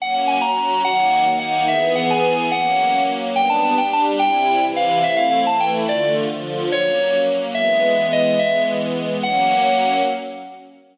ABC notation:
X:1
M:6/8
L:1/8
Q:3/8=143
K:F#mix
V:1 name="Electric Piano 2"
f f g a3 | f4 f2 | e e f g3 | f4 z2 |
[K:Gmix] g a a g a z | g4 f2 | e f f a g z | d2 z4 |
[K:F#mix] c4 z2 | e4 d2 | e2 z4 | f6 |]
V:2 name="String Ensemble 1"
[F,A,C]3 [F,CF]3 | [D,F,A,]3 [D,A,D]3 | [E,B,G]6 | [F,A,C]6 |
[K:Gmix] [G,B,D]3 [G,DG]3 | [C,G,E]3 [C,E,E]3 | [A,CE]3 [E,A,E]3 | [D,A,F]3 [D,F,F]3 |
[K:F#mix] [F,A,C]6 | [E,G,B,]6 | [E,G,B,]6 | [F,A,C]6 |]